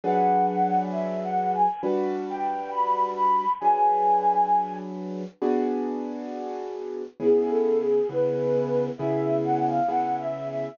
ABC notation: X:1
M:4/4
L:1/16
Q:1/4=67
K:Emix
V:1 name="Flute"
f2 f2 (3e2 f2 g2 z2 =g2 b2 b2 | g6 z10 | (3G2 A2 G2 B4 e2 f ^e (3f2 =e2 e2 |]
V:2 name="Acoustic Grand Piano"
[F,DGB]8 [=G,DFB]8 | [F,DGB]8 [B,DFG]8 | [C,B,EG]4 [C,B,EG]4 [C,B,EG]4 [C,B,EG]4 |]